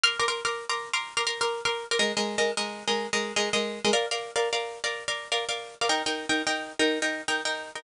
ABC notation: X:1
M:6/8
L:1/16
Q:3/8=123
K:Bbmix
V:1 name="Pizzicato Strings"
[Bc'd'f']2 [Bc'd'f'] [Bc'd'f']2 [Bc'd'f']3 [Bc'd'f']3 [Bc'd'f']- | [Bc'd'f']2 [Bc'd'f'] [Bc'd'f']2 [Bc'd'f']3 [Bc'd'f']3 [Bc'd'f'] | [A,Be]2 [A,Be]3 [A,Be]2 [A,Be]4 [A,Be]- | [A,Be]2 [A,Be]3 [A,Be]2 [A,Be]4 [A,Be] |
[Bdf]2 [Bdf]3 [Bdf]2 [Bdf]4 [Bdf]- | [Bdf]2 [Bdf]3 [Bdf]2 [Bdf]4 [Bdf] | [EBg]2 [EBg]3 [EBg]2 [EBg]4 [EBg]- | [EBg]2 [EBg]3 [EBg]2 [EBg]4 [EBg] |]